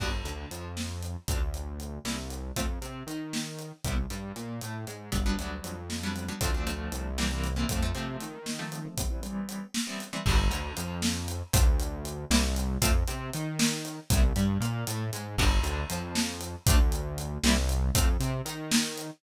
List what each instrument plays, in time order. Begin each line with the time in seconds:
0.00 synth bass 1 G1, acoustic guitar (steel) B3 D4 F#4 G4, kick, crash
0.24 synth bass 1 D2, acoustic guitar (steel) D3, closed hi-hat
0.51 synth bass 1 F2, acoustic guitar (steel) F3, closed hi-hat
0.77 snare
1.03 closed hi-hat
1.28 synth bass 1 D2, acoustic guitar (steel) A3 C4 D4 F4, kick, closed hi-hat
1.54 closed hi-hat
1.80 closed hi-hat
2.04 synth bass 1 C2, acoustic guitar (steel) G3 A#3 C4 E4, snare
2.30 closed hi-hat
2.56 synth bass 1 F2, acoustic guitar (steel) A3 C4 F4, kick, closed hi-hat
2.82 synth bass 1 C3, acoustic guitar (steel) C4, closed hi-hat
3.07 synth bass 1 D#3, acoustic guitar (steel) D#4, closed hi-hat
3.33 snare
3.59 closed hi-hat
3.84 synth bass 1 C2, acoustic guitar (steel) G3 B3 C4 E4, kick, closed hi-hat
4.10 synth bass 1 G2, acoustic guitar (steel) G3, closed hi-hat
4.36 synth bass 1 A#2, acoustic guitar (steel) A#3, closed hi-hat
4.61 synth bass 1 A2, acoustic guitar (steel) A3, closed hi-hat
4.87 synth bass 1 G#2, acoustic guitar (steel) G#3, closed hi-hat
5.12 synth bass 1 G1, acoustic guitar (steel) F#3 G3 B3 D4, kick, closed hi-hat
5.26 acoustic guitar (steel) F#3 G3 B3 D4
5.38 synth bass 1 D2, acoustic guitar (steel) F#3 G3 B3 D4, closed hi-hat
5.64 synth bass 1 F2, closed hi-hat
5.90 snare
6.03 acoustic guitar (steel) F#3 G3 B3 D4
6.16 closed hi-hat
6.28 acoustic guitar (steel) F#3 G3 B3 D4
6.41 synth bass 1 D2, acoustic guitar (steel) F3 A3 C4 D4, kick, closed hi-hat
6.54 acoustic guitar (steel) F3 A3 C4 D4
6.67 acoustic guitar (steel) F3 A3 C4 D4, closed hi-hat
6.92 synth bass 1 C2, closed hi-hat
7.18 acoustic guitar (steel) E3 G3 A#3 C4, snare
7.31 acoustic guitar (steel) E3 G3 A#3 C4
7.44 closed hi-hat
7.56 acoustic guitar (steel) E3 G3 A#3 C4
7.69 synth bass 1 F2, acoustic guitar (steel) F3 A3 C4, kick, closed hi-hat
7.82 acoustic guitar (steel) F3 A3 C4
7.95 synth bass 1 C3, acoustic guitar (steel) F3 A3 C4, closed hi-hat
8.21 synth bass 1 D#3, closed hi-hat
8.46 snare
8.59 acoustic guitar (steel) F3 A3 C4
8.72 closed hi-hat
8.85 acoustic guitar (steel) F3 A3 C4
8.97 acoustic guitar (steel) E3 G3 B3 C4, kick, closed hi-hat
9.10 acoustic guitar (steel) E3 G3 B3 C4
9.23 acoustic guitar (steel) E3 G3 B3 C4, closed hi-hat
9.49 closed hi-hat
9.74 snare
9.87 acoustic guitar (steel) E3 G3 B3 C4
10.00 closed hi-hat
10.13 acoustic guitar (steel) E3 G3 B3 C4
10.26 synth bass 1 G1, acoustic guitar (steel) B3 D4 F#4 G4, kick, crash
10.50 synth bass 1 D2, acoustic guitar (steel) D3, closed hi-hat
10.76 synth bass 1 F2, acoustic guitar (steel) F3, closed hi-hat
11.02 snare
11.28 closed hi-hat
11.53 synth bass 1 D2, acoustic guitar (steel) A3 C4 D4 F4, kick, closed hi-hat
11.80 closed hi-hat
12.05 closed hi-hat
12.30 synth bass 1 C2, acoustic guitar (steel) G3 A#3 C4 E4, snare
12.56 closed hi-hat
12.82 synth bass 1 F2, acoustic guitar (steel) A3 C4 F4, kick, closed hi-hat
13.07 synth bass 1 C3, acoustic guitar (steel) C4, closed hi-hat
13.33 synth bass 1 D#3, acoustic guitar (steel) D#4, closed hi-hat
13.59 snare
13.85 closed hi-hat
14.10 synth bass 1 C2, acoustic guitar (steel) G3 B3 C4 E4, kick, closed hi-hat
14.36 synth bass 1 G2, acoustic guitar (steel) G3, closed hi-hat
14.60 synth bass 1 A#2, acoustic guitar (steel) A#3, closed hi-hat
14.87 synth bass 1 A2, acoustic guitar (steel) A3, closed hi-hat
15.13 synth bass 1 G#2, acoustic guitar (steel) G#3, closed hi-hat
15.38 synth bass 1 G1, acoustic guitar (steel) B3 D4 F#4 G4, kick, crash
15.63 synth bass 1 D2, acoustic guitar (steel) D3, closed hi-hat
15.90 synth bass 1 F2, acoustic guitar (steel) F3, closed hi-hat
16.15 snare
16.41 closed hi-hat
16.67 synth bass 1 D2, acoustic guitar (steel) A3 C4 D4 F4, kick, closed hi-hat
16.92 closed hi-hat
17.18 closed hi-hat
17.43 synth bass 1 C2, acoustic guitar (steel) G3 A#3 C4 E4, snare
17.69 closed hi-hat
17.95 synth bass 1 F2, acoustic guitar (steel) A3 C4 F4, kick, closed hi-hat
18.20 synth bass 1 C3, acoustic guitar (steel) C4, closed hi-hat
18.45 synth bass 1 D#3, acoustic guitar (steel) D#4, closed hi-hat
18.71 snare
18.98 closed hi-hat